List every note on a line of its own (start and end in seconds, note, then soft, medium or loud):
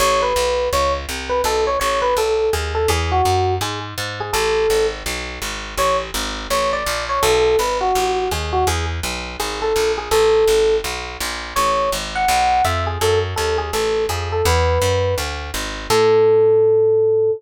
0.00 0.33 A1 loud
0.00 0.21 C#5 medium
0.22 0.69 B4 medium
0.36 0.69 B1 medium
0.73 1.06 C#2 medium
0.73 0.93 C#5 medium
1.09 1.42 C2 medium
1.29 1.41 B4 medium
1.44 1.77 B1 medium
1.44 1.64 A4 medium
1.67 1.79 C#5 medium
1.80 2.14 A1 medium
1.80 2.00 C#5 medium
2.02 2.15 B4 medium
2.17 2.50 B1 medium
2.17 2.50 A4 medium
2.53 2.86 D#2 medium
2.53 2.73 G#4 medium
2.75 2.89 A4 medium
2.88 3.22 E2 loud
2.88 3.11 G#4 medium
3.12 3.54 F#4 medium
3.25 3.59 F#2 medium
3.61 3.94 G#2 medium
3.61 3.80 G#4 medium
3.98 4.31 G#2 medium
4.20 4.34 G#4 medium
4.33 4.67 A1 loud
4.33 4.86 A4 medium
4.70 5.03 G#1 medium
5.06 5.39 B1 medium
5.42 5.75 G#1 medium
5.77 6.11 A1 medium
5.77 5.97 C#5 medium
6.14 6.47 G#1 medium
6.50 6.84 A1 medium
6.50 6.71 C#5 medium
6.73 7.05 D5 medium
6.86 7.20 A#1 medium
7.09 7.22 C#5 medium
7.23 7.56 B1 loud
7.23 7.58 A4 medium
7.59 7.92 G#1 medium
7.59 7.78 B4 medium
7.81 8.29 F#4 medium
7.95 8.29 A1 medium
8.31 8.65 D#2 medium
8.31 8.53 G#4 medium
8.53 8.66 F#4 medium
8.67 9.00 E2 medium
8.67 8.86 G#4 medium
9.03 9.37 B1 medium
9.40 9.73 G#1 medium
9.40 9.60 G#4 medium
9.62 9.91 A4 medium
9.76 10.09 A#1 medium
9.98 10.10 G#4 medium
10.11 10.45 A1 medium
10.11 10.76 A4 medium
10.48 10.81 G#1 medium
10.84 11.17 B1 medium
11.20 11.54 A#1 medium
11.56 11.90 A1 medium
11.56 11.90 C#5 medium
11.92 12.26 G#1 medium
12.15 12.63 F#5 medium
12.28 12.62 B1 medium
12.65 12.98 F2 medium
12.65 12.85 E5 medium
12.87 12.98 G#4 medium
13.01 13.34 F#2 medium
13.01 13.19 A4 medium
13.36 13.71 D#2 medium
13.36 13.57 A4 medium
13.58 13.72 G#4 medium
13.73 14.07 A1 medium
13.73 14.04 A4 medium
14.09 14.42 F2 medium
14.09 14.29 G#4 medium
14.32 14.45 A4 medium
14.45 14.79 E2 loud
14.45 15.15 B4 medium
14.82 15.15 F#2 medium
15.18 15.51 D2 medium
15.54 15.87 G#1 medium
15.90 17.31 A2 loud
15.90 17.31 A4 loud